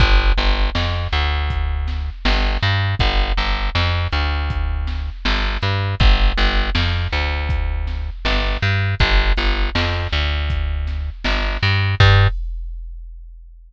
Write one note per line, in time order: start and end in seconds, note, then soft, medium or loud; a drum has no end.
0.00 0.33 G1 medium
0.00 kick loud
0.00 closed hi-hat loud
0.37 0.70 G1 medium
0.37 closed hi-hat medium
0.75 1.08 F2 medium
0.75 snare loud
1.12 2.10 D2 medium
1.12 closed hi-hat medium
1.50 kick medium
1.50 closed hi-hat loud
1.88 snare medium
1.88 closed hi-hat medium
2.25 2.58 G1 medium
2.25 snare loud
2.62 2.95 G2 medium
2.62 closed hi-hat medium
2.99 3.33 G1 medium
2.99 kick loud
2.99 closed hi-hat loud
3.38 3.70 G1 medium
3.38 closed hi-hat medium
3.75 4.08 F2 medium
3.75 snare medium
4.12 5.10 D2 medium
4.12 closed hi-hat medium
4.50 kick medium
4.50 closed hi-hat loud
4.87 snare medium
4.87 closed hi-hat medium
5.25 5.58 G1 medium
5.25 snare loud
5.62 5.95 G2 medium
5.62 closed hi-hat medium
6.00 6.33 G1 medium
6.00 kick loud
6.00 closed hi-hat loud
6.38 6.70 G1 medium
6.38 closed hi-hat medium
6.75 7.08 F2 medium
6.75 snare loud
7.12 8.10 D2 medium
7.12 closed hi-hat medium
7.49 kick medium
7.49 closed hi-hat loud
7.87 snare medium
7.87 closed hi-hat medium
8.25 8.57 G1 medium
8.25 snare loud
8.62 8.95 G2 medium
8.62 closed hi-hat medium
9.00 9.33 G1 medium
9.00 kick loud
9.00 closed hi-hat loud
9.37 9.70 G1 medium
9.37 closed hi-hat medium
9.75 10.08 F2 medium
9.75 snare loud
10.12 11.10 D2 medium
10.12 closed hi-hat medium
10.50 kick medium
10.50 closed hi-hat loud
10.87 snare medium
10.87 closed hi-hat medium
11.24 11.58 G1 medium
11.24 snare loud
11.62 11.95 G2 medium
11.62 open hi-hat medium
12.00 12.28 G2 loud
12.00 kick loud
12.00 crash loud